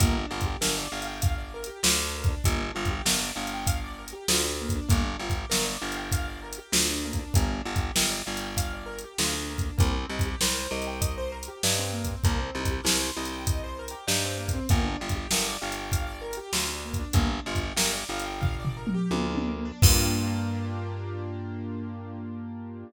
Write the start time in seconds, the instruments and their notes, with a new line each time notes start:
0.00 electric bass (finger) G1, acoustic grand piano A#3, kick, closed hi-hat
0.16 acoustic grand piano D4
0.31 electric bass (finger) G1, acoustic grand piano F4
0.41 kick, closed hi-hat
0.46 acoustic grand piano G4
0.61 electric bass (finger) G1, acoustic grand piano A#4, snare
0.78 acoustic grand piano D5
0.92 electric bass (finger) G1, acoustic grand piano F5
1.02 closed hi-hat
1.07 acoustic grand piano G5
1.21 acoustic grand piano F5, kick, closed hi-hat
1.38 acoustic grand piano D5
1.54 acoustic grand piano A#4
1.64 acoustic grand piano G4, closed hi-hat
1.83 electric bass (finger) D2, acoustic grand piano F4, snare
1.99 acoustic grand piano D4
2.15 acoustic grand piano A#3
2.24 kick, closed hi-hat
2.28 acoustic grand piano D4
2.44 electric bass (finger) G1, acoustic grand piano A#3, kick, closed hi-hat
2.61 acoustic grand piano D4
2.75 electric bass (finger) G1, acoustic grand piano F4
2.85 kick, closed hi-hat
2.90 acoustic grand piano G4
3.05 electric bass (finger) G1, acoustic grand piano A#4, snare
3.21 acoustic grand piano D5
3.35 electric bass (finger) G1, acoustic grand piano F5
3.47 closed hi-hat
3.54 acoustic grand piano G5
3.67 acoustic grand piano F5, kick, closed hi-hat
3.84 acoustic grand piano D5
3.99 acoustic grand piano A#4
4.08 closed hi-hat
4.13 acoustic grand piano G4
4.28 electric bass (finger) D2, acoustic grand piano F4, snare
4.44 acoustic grand piano D4
4.61 acoustic grand piano A#3
4.69 kick, closed hi-hat
4.76 acoustic grand piano D4
4.89 electric bass (finger) G1, acoustic grand piano A#3, kick, closed hi-hat
5.05 acoustic grand piano D4
5.19 electric bass (finger) G1, acoustic grand piano F4
5.30 kick, closed hi-hat
5.35 acoustic grand piano G4
5.50 electric bass (finger) G1, acoustic grand piano A#4, snare
5.65 acoustic grand piano D5
5.82 electric bass (finger) G1, acoustic grand piano F5
5.92 closed hi-hat
5.97 acoustic grand piano G5
6.12 acoustic grand piano F5, kick, closed hi-hat
6.28 acoustic grand piano D5
6.42 acoustic grand piano A#4
6.53 closed hi-hat
6.58 acoustic grand piano G4
6.72 electric bass (finger) D2, acoustic grand piano F4, snare
6.90 acoustic grand piano D4
7.04 acoustic grand piano A#3
7.13 kick, closed hi-hat
7.19 acoustic grand piano D4
7.34 electric bass (finger) G1, acoustic grand piano A#3, kick, closed hi-hat
7.50 acoustic grand piano D4
7.65 electric bass (finger) G1, acoustic grand piano F4
7.76 kick, closed hi-hat
7.80 acoustic grand piano G4
7.95 electric bass (finger) G1, acoustic grand piano A#4, snare
8.10 acoustic grand piano D5
8.26 electric bass (finger) G1, acoustic grand piano F5
8.37 acoustic grand piano G5, closed hi-hat
8.57 acoustic grand piano F5, kick, closed hi-hat
8.73 acoustic grand piano D5
8.86 acoustic grand piano A#4
8.99 closed hi-hat
9.04 acoustic grand piano G4
9.18 electric bass (finger) D2, acoustic grand piano F4, snare
9.33 acoustic grand piano D4
9.50 acoustic grand piano A#3
9.58 kick, closed hi-hat
9.63 acoustic grand piano D4
9.78 electric bass (finger) C2, acoustic grand piano A#3, kick, closed hi-hat
9.96 acoustic grand piano C4
10.09 electric bass (finger) C2, acoustic grand piano D#4
10.19 kick, closed hi-hat
10.26 acoustic grand piano G4
10.41 electric bass (finger) C2, acoustic grand piano A#4, snare
10.58 acoustic grand piano C5
10.71 electric bass (finger) C2, acoustic grand piano D#5
10.82 closed hi-hat
10.87 acoustic grand piano G5
11.01 acoustic grand piano D#5, kick, closed hi-hat
11.18 acoustic grand piano C5
11.32 acoustic grand piano A#4
11.43 closed hi-hat
11.48 acoustic grand piano G4
11.63 electric bass (finger) G2, acoustic grand piano D#4, snare
11.78 acoustic grand piano C4
11.92 acoustic grand piano A#3
12.04 acoustic grand piano C4, kick, closed hi-hat
12.24 electric bass (finger) C2, acoustic grand piano A#3, kick, closed hi-hat
12.39 acoustic grand piano C4
12.55 electric bass (finger) C2, acoustic grand piano D#4
12.65 kick, closed hi-hat
12.71 acoustic grand piano G4
12.84 electric bass (finger) C2, acoustic grand piano A#4, snare
13.00 acoustic grand piano C5
13.16 electric bass (finger) C2, acoustic grand piano D#5
13.25 closed hi-hat
13.33 acoustic grand piano G5
13.46 acoustic grand piano D#5, kick, closed hi-hat
13.64 acoustic grand piano C5
13.79 acoustic grand piano A#4
13.88 acoustic grand piano G4, closed hi-hat
14.07 electric bass (finger) G2, acoustic grand piano D#4, snare
14.24 acoustic grand piano C4
14.38 acoustic grand piano A#3
14.48 kick, closed hi-hat
14.53 acoustic grand piano C4
14.69 electric bass (finger) G1, acoustic grand piano A#3, kick, closed hi-hat
14.84 acoustic grand piano D4
15.00 electric bass (finger) G1, acoustic grand piano F4
15.09 kick, closed hi-hat
15.16 acoustic grand piano G4
15.31 electric bass (finger) G1, acoustic grand piano A#4, snare
15.45 acoustic grand piano D5
15.61 electric bass (finger) G1, acoustic grand piano F5
15.72 closed hi-hat
15.77 acoustic grand piano G5
15.91 acoustic grand piano F5, kick, closed hi-hat
16.07 acoustic grand piano D5
16.21 acoustic grand piano A#4
16.33 closed hi-hat
16.37 acoustic grand piano G4
16.53 electric bass (finger) D2, acoustic grand piano F4, snare
16.68 acoustic grand piano D4
16.85 acoustic grand piano A#3
16.94 kick, closed hi-hat
17.00 acoustic grand piano D4
17.13 electric bass (finger) G1, acoustic grand piano A#3, kick, closed hi-hat
17.28 acoustic grand piano D4
17.46 electric bass (finger) G1, acoustic grand piano F4
17.55 kick, closed hi-hat
17.62 acoustic grand piano G4
17.77 electric bass (finger) G1, acoustic grand piano A#4, snare
17.93 acoustic grand piano D5
18.09 electric bass (finger) G1, acoustic grand piano F5
18.19 closed hi-hat
18.25 acoustic grand piano G5
18.41 acoustic grand piano F5, kick, floor tom
18.60 acoustic grand piano D5
18.65 floor tom
18.77 acoustic grand piano A#4
18.87 mid tom
18.94 acoustic grand piano G4
19.11 electric bass (finger) D2, acoustic grand piano F4, high tom
19.29 acoustic grand piano D4
19.35 high tom
19.47 acoustic grand piano A#3
19.65 acoustic grand piano D4
19.82 electric bass (finger) G2, acoustic grand piano A#3 D4 F4 G4, kick, crash